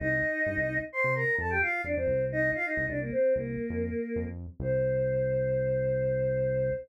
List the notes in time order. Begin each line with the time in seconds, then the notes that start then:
0.00 C2 D#4 D#5
0.46 G2
0.57 C2
0.93 C5 C6
1.04 C3
1.15 A#4 A#5
1.38 F2 A4 A5
1.50 G4 G5
1.61 F4 F5
1.84 F2 D4 D5
1.96 F2 C4 C5
2.07 C2
2.32 D#4 D#5
2.55 F4 F5
2.65 D#4 D#5
2.77 C2
2.88 C2 D4 D5
3.01 A#3 A#4
3.12 C4 C5
3.34 C2 A#3 A#4
3.70 F2
4.16 F2
4.26 F2
4.60 C2 C5